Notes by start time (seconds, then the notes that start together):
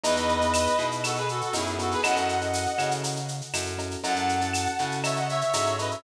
0.04 E2 B3 D#4 E4 G#4 B4 D#5, cowbell, shaker
0.16 B3 D#4 E4 G#4, shaker
0.29 shaker
0.41 B3 D#4 E4 G#4, shaker
0.54 tambourine, claves, shaker
0.66 shaker
0.79 B2 B3 D#4 E4 G#4, shaker
0.91 shaker
1.04 F#4 A4, cowbell, claves, shaker
1.16 G#4 B4, shaker
1.29 F#4 A4, shaker
1.41 F#4 A4, shaker
1.53 F#2 B3 D#4 E4 G#4, tambourine, cowbell, shaker
1.66 shaker
1.78 B3 D#4 E4 F#4 G#4 A4, cowbell, shaker
1.91 G#4 B4, shaker
2.03 F#2 C#4 E4 F#4 A4 D#5 F#5, cowbell, claves, shaker
2.16 C#4 E4 F#4 A4, shaker
2.29 shaker
2.41 C#4 E4 F#4 A4, shaker
2.54 tambourine, shaker
2.66 shaker
2.78 C#3 C#4 E4 F#4 A4, claves, shaker
2.91 shaker
3.04 cowbell, shaker
3.16 shaker
3.28 shaker
3.41 shaker
3.54 F#2 C#4 E4 F#4 A4, tambourine, cowbell, claves, shaker
3.66 shaker
3.78 C#4 E4 F#4 A4, cowbell, shaker
3.91 shaker
4.03 F#2 C#4 E4 F#4 A4 F#5 A5, cowbell, shaker
4.16 C#4 E4 F#4 A4, shaker
4.29 shaker
4.41 C#4 E4 F#4 A4, shaker
4.54 tambourine, claves, shaker
4.66 shaker
4.79 C#3 C#4 E4 F#4 A4, shaker
4.91 shaker
5.04 C#5 E5, cowbell, claves, shaker
5.16 D#5 F#5, shaker
5.29 C#5 E5, shaker
5.41 C#5 E5, shaker
5.54 G#2 C#4 E4 F#4 A4 C#5 E5, tambourine, cowbell, shaker
5.66 shaker
5.79 C#4 E4 F#4 A4 B4 D#5, cowbell, shaker
5.91 C#5 E5, shaker